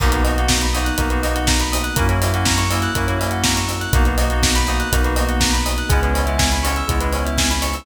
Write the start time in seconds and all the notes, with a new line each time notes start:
0.00 B1 A#3 B3 D#4 F#4 A#4, kick, crash
0.12 A#3 B3 D#4 F#4 B4, closed hi-hat
0.24 A#3 B3 D#4 F#4 D#5, open hi-hat
0.37 A#3 B3 D#4 F#4 F#5, closed hi-hat
0.48 A#5, kick, snare
0.61 B5, closed hi-hat
0.74 A#3 B3 D#4 F#4 D#6, open hi-hat
0.85 F#6, closed hi-hat
0.98 B1 A#3 B3 D#4 F#4 A#4, kick, closed hi-hat
1.10 A#3 B3 D#4 F#4 B4, closed hi-hat
1.23 A#3 B3 D#4 F#4 D#5, open hi-hat
1.35 F#5, closed hi-hat
1.47 A#5, kick, snare
1.60 B5, closed hi-hat
1.72 D#6, open hi-hat
1.84 F#6, closed hi-hat
1.96 F#2 A#3 C#4 E4 F#4 A#4, kick, closed hi-hat
2.09 A#3 C#4 E4 F#4 C#5, closed hi-hat
2.21 A#3 C#4 E4 F#4 E5, open hi-hat
2.33 A#3 C#4 E4 F#4 F#5, closed hi-hat
2.45 A#5, kick, snare
2.58 C#6, closed hi-hat
2.70 A#3 C#4 E4 F#4 E6, open hi-hat
2.82 F#6, closed hi-hat
2.95 F#2 A#3 C#4 E4 F#4 A#4, kick, closed hi-hat
3.07 A#3 C#4 E4 F#4 C#5, closed hi-hat
3.19 A#3 C#4 E4 F#4 E5, open hi-hat
3.31 F#5, closed hi-hat
3.44 A#5, kick, snare
3.56 C#6, closed hi-hat
3.68 E6, open hi-hat
3.81 F#6, closed hi-hat
3.93 B1 A#3 B3 D#4 F#4 A#4, kick, closed hi-hat
4.05 A#3 B3 D#4 F#4 B4, closed hi-hat
4.18 A#3 B3 D#4 F#4 D#5, open hi-hat
4.30 A#3 B3 D#4 F#4 F#5, closed hi-hat
4.43 A#5, kick, snare
4.55 B5, closed hi-hat
4.67 A#3 B3 D#4 F#4 D#6, open hi-hat
4.80 F#6, closed hi-hat
4.92 B1 A#3 B3 D#4 F#4 A#4, kick, closed hi-hat
5.04 A#3 B3 D#4 F#4 B4, closed hi-hat
5.16 A#3 B3 D#4 F#4 D#5, open hi-hat
5.29 F#5, closed hi-hat
5.40 A#5, kick, snare
5.53 B5, closed hi-hat
5.65 D#6, open hi-hat
5.78 F#6, closed hi-hat
5.89 C#2 G#3 B3 C#4 E4 G#4, kick, closed hi-hat
6.03 G#3 B3 C#4 E4 B4, closed hi-hat
6.14 G#3 B3 C#4 E4 C#5, open hi-hat
6.26 G#3 B3 C#4 E4 E5, closed hi-hat
6.38 G#5, kick, snare
6.52 B5, closed hi-hat
6.63 G#3 B3 C#4 E4 C#6, open hi-hat
6.76 E6, closed hi-hat
6.87 C#2 G#3 B3 C#4 E4 G#4, kick, closed hi-hat
7.01 G#3 B3 C#4 E4 B4, closed hi-hat
7.12 G#3 B3 C#4 E4 C#5, open hi-hat
7.25 E5, closed hi-hat
7.38 G#5, kick, snare
7.50 B5, closed hi-hat
7.62 C#6, open hi-hat
7.74 E6, open hi-hat